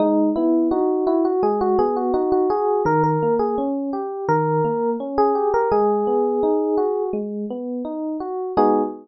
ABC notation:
X:1
M:4/4
L:1/16
Q:1/4=84
K:G#m
V:1 name="Electric Piano 1"
D2 E2 F2 E F G F G F F F G2 | A A2 G z4 A4 z G2 A | G8 z8 | G4 z12 |]
V:2 name="Electric Piano 1"
G,2 B,2 D2 F2 G,2 B,2 D2 F2 | D,2 A,2 C2 =G2 D,2 A,2 C2 G2 | G,2 B,2 D2 F2 G,2 B,2 D2 F2 | [G,B,DF]4 z12 |]